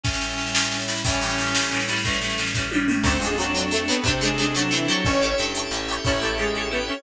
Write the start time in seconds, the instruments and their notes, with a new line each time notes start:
0.03 pad 5 (bowed) A2 G3 C#4 E4, clarinet C#4, drawbar organ A4 C#5 E5 G5, kick, snare
0.13 snare
0.21 snare
0.30 snare
0.38 snare
0.46 snare
0.55 snare
0.63 snare
0.71 snare
0.80 snare
0.87 clarinet E4, snare
0.96 snare
1.04 acoustic guitar (steel) A2 E3 G3, pad 5 (bowed) A2 G3 C#4 E4, drawbar organ A3 C#4 E4 G4, clarinet C#4, kick, snare
1.09 acoustic guitar (steel) C#4
1.13 snare
1.21 acoustic guitar (steel) A2 E3 G3, snare
1.25 acoustic guitar (steel) C#4
1.30 snare
1.38 acoustic guitar (steel) A2 E3 G3, snare
1.42 acoustic guitar (steel) C#4
1.46 snare
1.54 pad 5 (bowed) A2 G3 A3 E4, acoustic guitar (steel) A2 E3 G3, snare
1.59 acoustic guitar (steel) C#4
1.63 snare
1.71 acoustic guitar (steel) A2 E3 G3, snare
1.76 acoustic guitar (steel) C#4, snare
1.88 acoustic guitar (steel) A2 E3 G3, clarinet E4, snare
1.92 acoustic guitar (steel) C#4
1.96 snare
2.04 acoustic guitar (steel) A2 E3 G3, pad 5 (bowed) A2 G3 C#4 E4, clarinet A3, kick, snare
2.08 acoustic guitar (steel) C#4
2.13 snare
2.21 acoustic guitar (steel) A2 E3 G3, snare
2.25 acoustic guitar (steel) C#4
2.30 snare
2.38 acoustic guitar (steel) A2 E3 G3, snare
2.42 acoustic guitar (steel) C#4
2.46 snare
2.54 pad 5 (bowed) A2 G3 A3 E4, acoustic guitar (steel) A2 E3 G3, kick, snare
2.59 acoustic guitar (steel) C#4
2.71 acoustic guitar (steel) A2 E3 G3, high tom
2.75 acoustic guitar (steel) C#4
2.88 acoustic guitar (steel) A2 E3 G3, mid tom
2.92 acoustic guitar (steel) C#4
3.04 electric bass (finger) D2, acoustic guitar (steel) F#3 A3 C4, drawbar organ C4 D4 F#4 A4, lead 2 (sawtooth) C4 C5, pad 5 (bowed) C4 D4 F#4 A4, clarinet D4, kick, crash
3.09 acoustic guitar (steel) D4
3.20 electric bass (finger) F2, acoustic guitar (steel) F#3 A3, lead 2 (sawtooth) G#3 G#4
3.24 acoustic guitar (steel) C4 D4
3.38 acoustic guitar (steel) F#3 A3 C4, lead 2 (sawtooth) F#3 F#4
3.42 acoustic guitar (steel) D4
3.55 acoustic guitar (steel) F#3 A3 C4
3.59 acoustic guitar (steel) D4
3.71 acoustic guitar (steel) F#3 A3 C4, lead 2 (sawtooth) A3 A4
3.75 acoustic guitar (steel) D4
3.88 acoustic guitar (steel) F#3 A3 C4, lead 2 (sawtooth) B3 B4
3.92 acoustic guitar (steel) D4
4.04 electric bass (finger) C3, acoustic guitar (steel) F#3 A3 C4, lead 2 (sawtooth) C4 C5, pad 5 (bowed) C4 D4 A4 C5, clarinet D4, kick
4.09 acoustic guitar (steel) D4
4.21 acoustic guitar (steel) F#3 A3 C4, lead 2 (sawtooth) G#3 G#4
4.25 acoustic guitar (steel) D4
4.38 acoustic guitar (steel) F#3 A3 C4, lead 2 (sawtooth) G#3 G#4
4.42 acoustic guitar (steel) D4
4.55 acoustic guitar (steel) F#3 A3 C4, lead 2 (sawtooth) F#3 F#4
4.59 acoustic guitar (steel) D4
4.71 lead 2 (sawtooth) E3 E4, acoustic guitar (steel) F#3 A3 C4
4.75 acoustic guitar (steel) D4
4.88 lead 2 (sawtooth) F#3 F#4, acoustic guitar (steel) E4 G4 A4
4.92 acoustic guitar (steel) C#5
5.05 electric bass (finger) A1, lead 2 (sawtooth) C#4 C#5, pad 5 (bowed) C#4 E4 G4 A4, clarinet A4, drawbar organ C#5 E5 G5 A5, kick
5.21 acoustic guitar (steel) E4 G4 A4
5.25 acoustic guitar (steel) C#5
5.38 electric bass (finger) G2, acoustic guitar (steel) E4 G4 A4
5.42 acoustic guitar (steel) C#5
5.55 acoustic guitar (steel) E4 G4 A4
5.59 acoustic guitar (steel) C#5
5.71 electric bass (finger) A1, acoustic guitar (steel) E4 G4 A4
5.75 acoustic guitar (steel) C#5
5.88 acoustic guitar (steel) E4 G4 A4
5.92 acoustic guitar (steel) C#5
6.05 electric bass (finger) A1, lead 2 (sawtooth) C#4 C#5, acoustic guitar (steel) E4 G4 A4, clarinet E4, kick
6.09 acoustic guitar (steel) C#5
6.21 lead 2 (sawtooth) A3 A4, acoustic guitar (steel) E4 G4 A4
6.25 acoustic guitar (steel) C#5
6.38 lead 2 (sawtooth) G#3 G#4, acoustic guitar (steel) E4 G4 A4
6.42 acoustic guitar (steel) C#5
6.55 acoustic guitar (steel) E4 G4 A4
6.59 acoustic guitar (steel) C#5
6.71 lead 2 (sawtooth) B3 B4, acoustic guitar (steel) E4 G4 A4
6.75 acoustic guitar (steel) C#5
6.88 lead 2 (sawtooth) C#4 C#5, acoustic guitar (steel) E4 G4 A4
6.92 acoustic guitar (steel) C#5